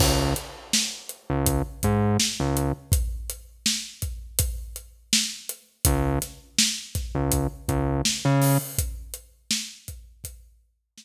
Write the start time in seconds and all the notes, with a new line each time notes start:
0.00 C#2, kick, crash
0.36 closed hi-hat
0.73 snare
1.09 closed hi-hat
1.30 C#2
1.46 kick, closed hi-hat
1.83 G#2, kick, closed hi-hat
2.20 snare
2.40 C#2
2.57 closed hi-hat
2.92 kick, closed hi-hat
3.30 closed hi-hat
3.66 snare
4.02 kick, closed hi-hat
4.39 kick, closed hi-hat
4.76 closed hi-hat
5.13 snare
5.49 closed hi-hat
5.85 C#2, kick, closed hi-hat
6.22 snare, closed hi-hat
6.59 snare
6.95 kick, snare, closed hi-hat
7.15 C#2
7.32 kick, closed hi-hat
7.68 C#2, kick, closed hi-hat
8.05 snare
8.25 C#3
8.42 snare, open hi-hat
8.78 kick, closed hi-hat
9.14 closed hi-hat
9.51 snare
9.88 kick, closed hi-hat
10.24 kick, closed hi-hat
10.98 snare